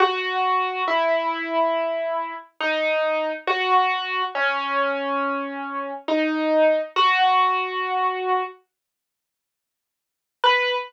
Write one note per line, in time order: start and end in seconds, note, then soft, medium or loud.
0.00 0.82 F#4 medium
0.88 2.34 E4 medium
2.61 3.30 D#4 medium
3.47 4.22 F#4 medium
4.35 5.91 C#4 medium
6.08 6.79 D#4 medium
6.96 8.43 F#4 medium
10.44 10.74 B4 loud